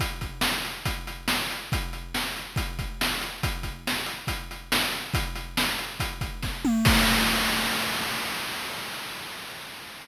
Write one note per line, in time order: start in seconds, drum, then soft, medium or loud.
0.00 kick medium
0.00 closed hi-hat medium
0.21 kick medium
0.21 closed hi-hat medium
0.41 snare medium
0.65 closed hi-hat medium
0.85 kick medium
0.85 closed hi-hat medium
1.07 closed hi-hat medium
1.28 snare medium
1.51 closed hi-hat medium
1.72 kick medium
1.72 closed hi-hat medium
1.93 closed hi-hat medium
2.14 snare medium
2.36 closed hi-hat medium
2.56 kick medium
2.56 closed hi-hat medium
2.79 kick medium
2.79 closed hi-hat medium
3.01 snare medium
3.21 closed hi-hat medium
3.43 kick medium
3.43 closed hi-hat medium
3.63 kick medium
3.63 closed hi-hat medium
3.87 snare medium
4.06 closed hi-hat medium
4.27 kick medium
4.27 closed hi-hat medium
4.51 closed hi-hat medium
4.72 snare loud
4.92 closed hi-hat medium
5.14 kick medium
5.14 closed hi-hat medium
5.35 closed hi-hat medium
5.57 snare medium
5.78 closed hi-hat medium
6.00 kick medium
6.00 closed hi-hat medium
6.21 kick medium
6.21 closed hi-hat medium
6.42 kick medium
6.42 snare medium
6.65 mid tom medium
6.85 kick loud
6.85 crash loud